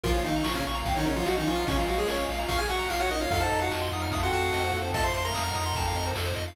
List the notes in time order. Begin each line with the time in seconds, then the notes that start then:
0.03 A#1 C#3 F3 A#3 C#4 F4 A#4, kick, crash
0.14 F3 F4 C#5
0.24 A#1 D#3 D#4 F5, ride
0.36 A#5
0.44 A#1 C#3 F3 A#3 F4 C#6, snare
0.55 C#3 C#4 F6
0.65 A#1 C#3 A#3 C#6, ride
0.75 A#5
0.85 A#1 D#3 C4 F5, kick, ride
0.95 D#3 F#3 D#4 C#5
1.06 A#1 C#3 C#4 A#4, ride
1.16 F3 F4 C#5
1.26 A#1 F#3 F#4 D#5 F5, snare
1.37 D#3 F3 C#4 D#4 A#5
1.47 A#1 F3 C#4 F4 C#6, ride
1.55 F#3 D#4 F6
1.67 A#1 C#3 G#3 C#4 F4 C#6, kick, ride
1.77 F3 F4 A#5
1.88 A#1 F#3 F#4 F5, ride
1.98 G#3 G#4 C#5
2.08 A#1 C#4 A#4 C#5, snare
2.18 C#5
2.29 A#1 F5, ride
2.39 A#5
2.48 A#1 F4 F5 C#6, kick, ride
2.57 G#4 G#5 F6
2.69 A#1 F#4 F#5 C#6, ride
2.79 A#5
2.90 A#1 F4 F5, snare
3.00 F#4 C#5 F#5
3.09 A#1 D#4 A#4 D#5, ride
3.21 F4 C#5 F5
3.30 F2 F#3 A3 C4 D#4 F4 A4 F5, kick, ride
3.40 A4 C5 A5
3.51 F2 D#5, ride
3.60 F#4 F5 F#5
3.70 F2 F#4 D#5 A5, snare
3.82 C6
3.92 F2 F#3 D#4 D#6, ride
4.02 F6
4.11 F2 A3 F4 D#6, kick, ride
4.23 C4 F#4 A4 F#5 C6
4.32 F2 F#4 F#5 A5, ride
4.41 F5
4.53 F2 C4 A4 D#5, snare
4.63 A#3 F#4 C5
4.73 F2 A#3 F#4 A4, ride
4.82 C4 A4 C5
4.93 F2 A3 F4 A4 D#5 A5, kick, ride
5.04 A3 F4 C5 F5 C6
5.14 F2 C5 A5 C6, ride
5.24 A3 F4 A#4 A#5 C6
5.34 F2 D#6, snare
5.44 F#3 D#4 F6
5.55 F2 D#6, ride
5.66 C6
5.75 F2 C4 A4 A5, kick, ride
5.87 F5
5.95 F2 D#5, ride
6.06 C5
6.15 F2 A4, snare
6.26 C5
6.36 F2 D#5, ride
6.48 F5